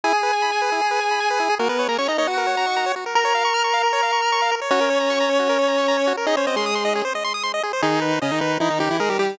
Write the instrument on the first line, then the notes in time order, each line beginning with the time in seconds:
lead 1 (square)
0.04 E4 G#4 G#5
0.13 G#4
0.23 B4
0.33 G#5
0.42 B5
0.52 G#5
0.62 B4
0.72 E4
0.81 G#4
0.91 B4
1.01 G#5
1.11 B5
1.20 G#5
1.30 B4
1.40 E4
1.50 G#4
1.59 A#3 F#4 A#4
1.69 B3 A#4 B4
1.79 C#5
1.88 A#3 A#4 A#5
1.98 C#4 C#5 C#6
2.08 D#4 D#5 A#5
2.18 D#4 C#5 D#5
2.27 F#4 F#5
2.38 A#4
2.47 C#5
2.57 A#5
2.66 C#6
2.76 A#5
2.86 C#5
2.96 F#4
3.06 A#4
3.15 A#4 A#5
3.25 C#5
3.35 F5
3.45 C#6
3.54 F6
3.64 C#6
3.73 F5
3.83 A#4
3.93 C#5
4.03 F5
4.12 C#6
4.22 F6
4.32 C#6
4.42 F5
4.52 A#4
4.61 C#5
4.71 C#4 F#4 C#5
4.81 A#4
4.90 C#5
5.00 A#5
5.10 C#6
5.20 A#5
5.30 C#5
5.39 F#4
5.49 A#4
5.59 C#5
5.68 A#5
5.78 C#6
5.88 A#5
5.97 C#5
6.07 F#4
6.17 A#4
6.26 D#4 G#4 D#5
6.37 C#4 C5 C#5
6.47 C4 C5 D#5
6.56 G#3 G#4 C6
6.66 D#6
6.75 C6
6.85 D#5
6.95 G#4
7.05 C5
7.15 D#5
7.24 C6
7.34 D#6
7.43 C6
7.54 D#5
7.63 G#4
7.73 C5
7.82 D#3 D#4 G#4
8.02 B4
8.22 C#3 C#4 D#5
8.31 D#3 D#4
8.41 D#3 D#4 B4
8.60 E3 D#4 E4
8.70 D#3 D#4
8.80 D#3 D#4 G4
8.91 E3 E4
9.00 G#3 G#4 A#4
9.10 G3 G4
9.19 G3 G4